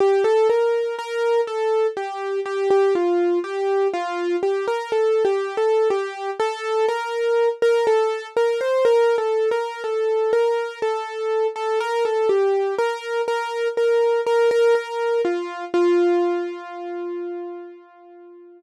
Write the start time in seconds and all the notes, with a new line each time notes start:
0.00 G4
0.24 A4
0.50 A#4
0.99 A#4
1.47 A4
1.97 G4
2.45 G4
2.70 G4
2.95 F4
3.44 G4
3.93 F4
4.43 G4
4.68 A#4
4.92 A4
5.25 G4
5.57 A4
5.90 G4
6.40 A4
6.89 A#4
7.62 A#4
7.87 A4
8.36 A#4
8.61 C5
8.85 A#4
9.18 A4
9.51 A#4
9.84 A4
10.33 A#4
10.82 A4
11.56 A4
11.80 A#4
12.05 A4
12.29 G4
12.78 A#4
13.28 A#4
13.77 A#4
14.26 A#4
14.51 A#4
14.75 A#4
15.25 F4
15.74 F4